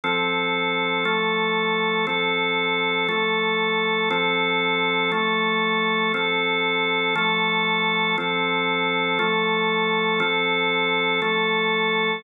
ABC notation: X:1
M:6/8
L:1/8
Q:3/8=59
K:Flyd
V:1 name="Drawbar Organ"
[F,CA]3 [F,A,A]3 | [F,CA]3 [F,A,A]3 | [F,CA]3 [F,A,A]3 | [F,CA]3 [F,A,A]3 |
[F,CA]3 [F,A,A]3 | [F,CA]3 [F,A,A]3 |]